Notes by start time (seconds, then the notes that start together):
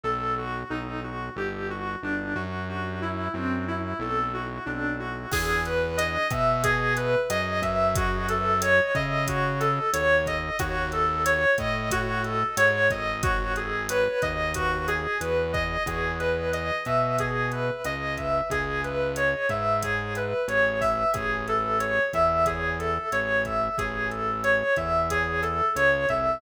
0.03 B1 A4
0.38 F#4
0.70 B1 D#4
1.04 F#4
1.36 G1 G4
1.70 F#4
2.03 G1 D4
2.35 F#2 F#4
2.69 F#4
3.02 E4
3.34 F#2 C4
3.68 E4
3.99 B1 A4
4.33 F#4
4.66 B1 D4
4.99 F#4
5.32 E2 G#4, kick, cross-stick, crash
5.65 B4, closed hi-hat
5.97 D#5, closed hi-hat
6.30 B2 E5, kick, cross-stick, closed hi-hat
6.63 G#4, kick, closed hi-hat
6.97 B4, closed hi-hat
7.29 F#2 D#5, cross-stick, closed hi-hat
7.62 F#2 E5, kick, closed hi-hat
7.95 F#4, kick, closed hi-hat
8.29 A4, closed hi-hat
8.61 C#5, cross-stick, closed hi-hat
8.95 C#3 D#5, kick, closed hi-hat
9.27 F#4, kick, closed hi-hat
9.60 A4, cross-stick, closed hi-hat
9.93 D#2 C#5, closed hi-hat
10.26 D#5, kick, closed hi-hat
10.59 D#2 F#4, kick, cross-stick, closed hi-hat
10.92 A4, closed hi-hat
11.25 C#5, closed hi-hat
11.58 A2 D#5, kick, cross-stick, closed hi-hat
11.91 F#4, kick, closed hi-hat
12.24 A4, closed hi-hat
12.57 G#2 C#5, cross-stick, closed hi-hat
12.90 G#1 D#5, kick, closed hi-hat
13.22 F#4, kick, closed hi-hat
13.56 G#4, closed hi-hat
13.89 B4, cross-stick, closed hi-hat
14.22 D#2 D#5, kick, closed hi-hat
14.54 F#4, kick, closed hi-hat
14.88 G#4, cross-stick, closed hi-hat
15.20 E2 B4, closed hi-hat
15.53 D#5, kick, closed hi-hat
15.86 E2 G#4, kick, cross-stick, closed hi-hat
16.19 B4, closed hi-hat
16.53 D#5, closed hi-hat
16.85 B2 E5, kick, cross-stick, closed hi-hat
17.19 G#4, kick, closed hi-hat
17.52 B4, closed hi-hat
17.84 C#2 D#5, cross-stick, closed hi-hat
18.17 E5, kick, closed hi-hat
18.50 C#2 G#4, kick, closed hi-hat
18.84 B4, closed hi-hat
19.16 C#5, cross-stick, closed hi-hat
19.49 G#2 E5, kick, closed hi-hat
19.83 G#4, kick, closed hi-hat
20.15 B4, cross-stick, closed hi-hat
20.48 A1 C#5, closed hi-hat
20.81 E5, kick, open hi-hat
21.13 A1 G#4, kick, cross-stick, closed hi-hat
21.48 A4, closed hi-hat
21.79 C#5, closed hi-hat
22.13 E2 E5, kick, cross-stick, closed hi-hat
22.46 G#4, kick, closed hi-hat
22.79 A4, closed hi-hat
23.12 A1 C#5, cross-stick, closed hi-hat
23.45 E5, kick, closed hi-hat
23.78 A1 G#4, kick, closed hi-hat
24.10 A4, closed hi-hat
24.44 C#5, cross-stick, closed hi-hat
24.76 E2 E5, kick, closed hi-hat
25.10 G#4, kick, closed hi-hat
25.42 A4, cross-stick, closed hi-hat
25.76 C#2 C#5, closed hi-hat
26.09 C2 E5, kick, closed hi-hat